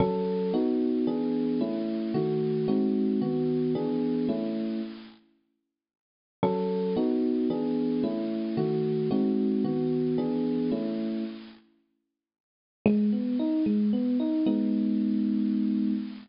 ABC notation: X:1
M:3/4
L:1/8
Q:1/4=112
K:C#m
V:1 name="Electric Piano 1"
[F,CA]2 [B,DF]2 [E,B,=DG]2 | [A,CE]2 [D,A,F]2 [G,^B,DF]2 | [D,B,F]2 [E,B,=DG]2 [A,CE]2 | z6 |
[F,CA]2 [B,DF]2 [E,B,=DG]2 | [A,CE]2 [D,A,F]2 [G,^B,DF]2 | [D,B,F]2 [E,B,=DG]2 [A,CE]2 | z6 |
[K:G#m] G, B, D G, B, D | [G,B,D]6 |]